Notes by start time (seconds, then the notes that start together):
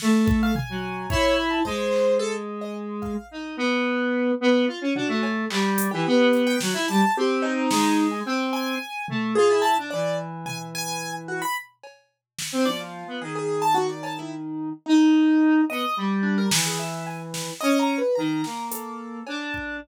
0.00 A3, snare
0.26 A4, kick
0.43 F5
0.55 G#5, floor tom
0.69 F#3
1.10 E4 C#5, kick
1.36 B5
1.50 A5
1.65 G#3 C5, kick
1.93 clap
2.19 A4
2.61 D#5
3.02 F5, kick
3.31 D#4
3.57 B3
4.40 B3
4.67 F4
4.81 C#4
4.95 D4 F#4, floor tom
5.08 A3
5.23 cowbell
5.50 G3, clap
5.78 closed hi-hat
5.91 E3 G4
6.06 B3
6.33 closed hi-hat
6.47 G5
6.61 F#3, snare
6.74 E4
6.88 G3 A5
7.17 C4 G4
7.42 D#4, cowbell
7.70 G#3, snare
8.11 G#5
8.26 C4 G5
8.53 G#5
9.08 A3, floor tom
9.35 F4 G#4
9.50 E4
9.62 A5
9.78 D4
9.90 E3 D5
10.46 G#5, floor tom
10.75 G#5
11.28 F#4
11.42 B5
11.83 cowbell
12.39 snare
12.52 C4
12.65 F3 D5, high tom
12.80 F4
13.07 B3
13.21 D#3 G#4
13.35 G#4
13.62 A5
13.74 F#4
13.89 D5
14.03 A5, cowbell
14.19 E4
14.86 D#4
15.70 B3 D#5
15.97 G3
16.23 D4
16.38 A#4
16.51 E3, snare
16.66 G#4
16.79 E5
17.07 G#5
17.34 snare
17.61 C#4 D#5
17.79 A#5
17.98 B4
18.15 D#3 A#5
18.44 A#3, snare
18.71 A4, closed hi-hat
19.27 D4, cowbell
19.54 kick